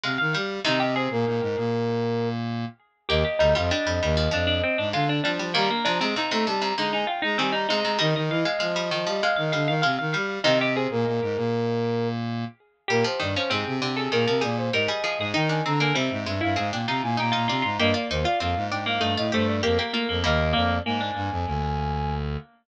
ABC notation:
X:1
M:4/4
L:1/16
Q:1/4=98
K:Eb
V:1 name="Brass Section"
z4 | e e c B9 z4 | e12 z4 | b4 b b =a b b _a g b a b2 b |
e12 z4 | e e c B9 z4 | B c d c A2 G A2 B d c e4 | g a b a =e2 e f2 g b a b4 |
e d c d f2 g f2 e c d B4 | e2 d2 a10 z2 |]
V:2 name="Pizzicato Strings"
f f f2 | E G A10 z4 | G G E F D4 D D C D F D D2 | B, B, D C E4 E E F E C E E2 |
e e f f f4 f f f f f f f2 | E G A10 z4 | G3 _D C3 =A B2 _A2 B A A A | E3 B, C3 =E A2 F2 G F F F |
B,3 F F3 B, =A,2 A,2 B, B, B, B, | B,2 B,2 B, D5 z6 |]
V:3 name="Harpsichord"
A, z G,2 | [C,E,]8 z8 | B,2 G, G, G, G, G, F, F,2 z2 A,2 G, G, | E,2 C, C, C, C, C, C, D,2 z2 E,2 C, C, |
G,3 A, A, G, E, F, A,2 G,2 A, z G,2 | [C,E,]8 z8 | G, F, E, F, C,2 D,2 E, F, G,2 G, G, F,2 | E D C D G,2 A,2 C D E2 E E D2 |
G F E F C2 D2 E F G2 G G F2 | [G,B,]14 z2 |]
V:4 name="Lead 1 (square)"
C, E, G,2 | C,3 B,, B,, A,, B,,8 z2 | E,, z D,, F,, z F,, E,,2 F,,2 z A,, D,2 F, F, | G, z F, A, z =A, G,2 _A,2 z A, G,2 A, A, |
E, E, =E, z F,2 F, G, z _E, D, E, C, E, G,2 | C,3 B,, B,, A,, B,,8 z2 | B,, z G,, z A,, C, C,2 B,, C, B,,2 A,, z2 A,, | E,2 D,2 C, A,, G,, G,, A,, B,, C, B,, B,, B,, C, A,, |
G,, z E,, z F,, A,, A,,2 G,, =A,, G,,2 F,, z2 F,, | E,,2 F,,2 A,,2 G,, F,, D,,6 z2 |]